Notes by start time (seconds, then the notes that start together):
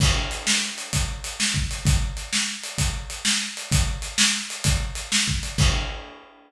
0.00 kick, crash
0.31 closed hi-hat
0.47 snare
0.78 closed hi-hat
0.93 kick, closed hi-hat
1.24 closed hi-hat
1.40 snare
1.54 kick
1.71 closed hi-hat
1.85 kick, closed hi-hat
2.17 closed hi-hat
2.33 snare
2.63 closed hi-hat
2.78 kick, closed hi-hat
3.10 closed hi-hat
3.25 snare
3.57 closed hi-hat
3.72 kick, closed hi-hat
4.02 closed hi-hat
4.18 snare
4.50 closed hi-hat
4.64 kick, closed hi-hat
4.95 closed hi-hat
5.12 snare
5.28 kick
5.43 closed hi-hat
5.58 kick, crash